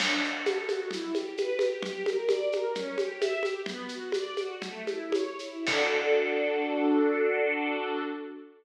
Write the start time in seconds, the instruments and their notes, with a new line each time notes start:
0.00 string ensemble 1 D4, crash, low conga, shaker
0.23 string ensemble 1 F#4, shaker
0.46 string ensemble 1 A4, high conga, shaker
0.68 string ensemble 1 F#4, high conga, shaker
0.91 string ensemble 1 E4, low conga, shaker
1.14 string ensemble 1 G4, high conga, shaker
1.37 string ensemble 1 B4, high conga, shaker
1.59 string ensemble 1 G4, high conga, shaker
1.83 string ensemble 1 G4, low conga, shaker
2.06 string ensemble 1 A#4, high conga, shaker
2.29 string ensemble 1 D5, high conga, shaker
2.51 string ensemble 1 A#4, high conga, shaker
2.75 string ensemble 1 C#4, low conga, shaker
2.98 string ensemble 1 G4, high conga, shaker
3.20 string ensemble 1 E5, high conga, shaker
3.43 string ensemble 1 G4, high conga, shaker
3.66 string ensemble 1 B3, low conga, shaker
3.89 string ensemble 1 F#4, shaker
4.12 string ensemble 1 D5, high conga, shaker
4.37 string ensemble 1 F#4, high conga, shaker
4.62 string ensemble 1 A3, low conga, shaker
4.87 string ensemble 1 E4, high conga, shaker
5.12 string ensemble 1 C#5, high conga, shaker
5.39 string ensemble 1 E4, shaker
5.66 string ensemble 1 D4 F#4 A4, kick, crash